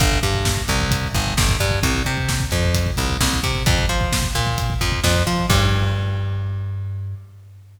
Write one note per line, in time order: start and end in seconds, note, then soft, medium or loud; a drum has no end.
0.00 0.19 G1 loud
0.00 kick loud
0.00 closed hi-hat loud
0.12 kick medium
0.23 0.62 G2 medium
0.23 kick medium
0.23 closed hi-hat medium
0.34 kick medium
0.45 kick medium
0.45 snare loud
0.57 kick medium
0.68 1.08 C2 medium
0.68 kick medium
0.68 closed hi-hat medium
0.81 kick medium
0.91 kick loud
0.91 closed hi-hat loud
1.03 kick medium
1.15 1.34 G1 medium
1.15 kick medium
1.15 closed hi-hat medium
1.27 kick medium
1.37 1.57 G1 medium
1.37 kick loud
1.37 snare loud
1.49 kick medium
1.60 1.80 G2 medium
1.60 kick medium
1.60 closed hi-hat medium
1.71 kick medium
1.83 2.03 C2 medium
1.83 kick loud
1.83 closed hi-hat loud
1.94 kick medium
2.05 2.45 C3 medium
2.05 kick medium
2.05 closed hi-hat medium
2.18 kick medium
2.29 kick medium
2.29 snare loud
2.40 kick medium
2.51 2.91 F2 medium
2.51 kick medium
2.51 closed hi-hat medium
2.64 kick medium
2.75 kick medium
2.75 closed hi-hat loud
2.86 kick medium
2.97 3.17 C2 medium
2.97 kick medium
2.97 closed hi-hat medium
3.10 kick medium
3.20 3.40 C2 medium
3.20 kick medium
3.20 snare loud
3.33 kick medium
3.43 3.63 C3 medium
3.43 kick medium
3.43 closed hi-hat medium
3.55 kick medium
3.66 3.86 F2 loud
3.66 kick loud
3.66 closed hi-hat loud
3.78 kick medium
3.89 4.28 F3 medium
3.89 kick medium
3.89 closed hi-hat medium
4.01 kick medium
4.12 kick medium
4.12 snare loud
4.23 kick medium
4.35 4.74 A#2 medium
4.35 kick medium
4.35 closed hi-hat medium
4.47 kick medium
4.58 kick medium
4.58 closed hi-hat loud
4.70 kick medium
4.81 5.00 F2 medium
4.81 kick medium
4.81 closed hi-hat medium
4.92 kick medium
5.04 5.23 F2 medium
5.04 kick medium
5.04 snare loud
5.15 kick medium
5.27 5.46 F3 medium
5.27 kick medium
5.27 closed hi-hat medium
5.38 kick medium
5.50 7.15 G2 loud
5.50 kick loud
5.50 crash loud